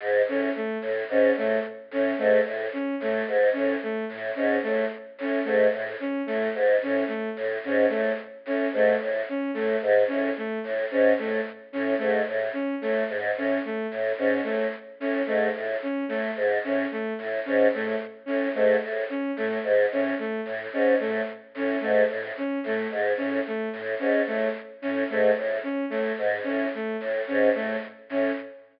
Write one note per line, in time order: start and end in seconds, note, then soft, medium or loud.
0.00 0.22 G#2 medium
0.27 0.49 A2 medium
0.27 0.50 C#4 medium
0.56 0.78 A3 medium
0.82 1.04 A2 medium
1.09 1.31 G#2 medium
1.09 1.33 C#4 medium
1.36 1.58 A2 medium
1.36 1.59 A3 medium
1.91 2.13 A2 medium
1.91 2.14 C#4 medium
2.18 2.40 G#2 medium
2.18 2.40 A3 medium
2.45 2.67 A2 medium
2.73 2.95 C#4 medium
3.00 3.22 A2 medium
3.00 3.23 A3 medium
3.27 3.49 G#2 medium
3.53 3.76 A2 medium
3.53 3.75 C#4 medium
3.83 4.05 A3 medium
4.09 4.31 A2 medium
4.35 4.58 G#2 medium
4.35 4.57 C#4 medium
4.63 4.86 A2 medium
4.63 4.85 A3 medium
5.18 5.40 A2 medium
5.18 5.42 C#4 medium
5.44 5.67 G#2 medium
5.44 5.66 A3 medium
5.73 5.95 A2 medium
6.00 6.22 C#4 medium
6.26 6.49 A2 medium
6.26 6.48 A3 medium
6.55 6.76 G#2 medium
6.82 7.04 A2 medium
6.82 7.04 C#4 medium
7.08 7.29 A3 medium
7.36 7.58 A2 medium
7.64 7.85 G#2 medium
7.64 7.87 C#4 medium
7.89 8.13 A2 medium
7.89 8.11 A3 medium
8.45 8.67 A2 medium
8.45 8.68 C#4 medium
8.73 8.95 G#2 medium
8.73 8.96 A3 medium
9.00 9.22 A2 medium
9.29 9.51 C#4 medium
9.54 9.76 A2 medium
9.54 9.76 A3 medium
9.82 10.04 G#2 medium
10.08 10.31 A2 medium
10.08 10.29 C#4 medium
10.37 10.59 A3 medium
10.64 10.85 A2 medium
10.91 11.13 G#2 medium
10.91 11.13 C#4 medium
11.18 11.40 A2 medium
11.18 11.41 A3 medium
11.73 11.95 A2 medium
11.73 11.94 C#4 medium
11.98 12.22 G#2 medium
11.98 12.20 A3 medium
12.27 12.49 A2 medium
12.53 12.75 C#4 medium
12.81 13.04 A2 medium
12.81 13.03 A3 medium
13.09 13.31 G#2 medium
13.36 13.58 A2 medium
13.36 13.60 C#4 medium
13.65 13.87 A3 medium
13.91 14.13 A2 medium
14.18 14.40 G#2 medium
14.18 14.41 C#4 medium
14.44 14.67 A2 medium
14.44 14.65 A3 medium
15.00 15.22 A2 medium
15.00 15.22 C#4 medium
15.26 15.49 G#2 medium
15.26 15.48 A3 medium
15.55 15.76 A2 medium
15.83 16.04 C#4 medium
16.09 16.31 A2 medium
16.09 16.30 A3 medium
16.36 16.58 G#2 medium
16.64 16.85 A2 medium
16.64 16.86 C#4 medium
16.91 17.13 A3 medium
17.18 17.40 A2 medium
17.45 17.67 G#2 medium
17.45 17.67 C#4 medium
17.73 17.95 A2 medium
17.73 17.96 A3 medium
18.26 18.49 A2 medium
18.26 18.48 C#4 medium
18.55 18.76 G#2 medium
18.55 18.76 A3 medium
18.82 19.04 A2 medium
19.10 19.31 C#4 medium
19.36 19.58 A2 medium
19.36 19.59 A3 medium
19.64 19.85 G#2 medium
19.91 20.13 A2 medium
19.91 20.14 C#4 medium
20.19 20.41 A3 medium
20.45 20.67 A2 medium
20.73 20.95 G#2 medium
20.73 20.95 C#4 medium
21.00 21.22 A2 medium
21.00 21.21 A3 medium
21.55 21.76 A2 medium
21.55 21.78 C#4 medium
21.80 22.04 G#2 medium
21.80 22.02 A3 medium
22.09 22.31 A2 medium
22.37 22.59 C#4 medium
22.64 22.85 A2 medium
22.64 22.88 A3 medium
22.91 23.13 G#2 medium
23.17 23.40 A2 medium
23.17 23.39 C#4 medium
23.47 23.69 A3 medium
23.73 23.95 A2 medium
23.99 24.22 G#2 medium
23.99 24.21 C#4 medium
24.27 24.49 A2 medium
24.27 24.49 A3 medium
24.82 25.04 A2 medium
24.82 25.04 C#4 medium
25.09 25.31 G#2 medium
25.09 25.31 A3 medium
25.36 25.58 A2 medium
25.63 25.85 C#4 medium
25.90 26.13 A2 medium
25.90 26.12 A3 medium
26.18 26.40 G#2 medium
26.44 26.67 A2 medium
26.44 26.66 C#4 medium
26.75 26.96 A3 medium
27.00 27.22 A2 medium
27.27 27.49 G#2 medium
27.27 27.49 C#4 medium
27.55 27.76 A2 medium
27.55 27.76 A3 medium
28.09 28.31 A2 medium
28.09 28.32 C#4 medium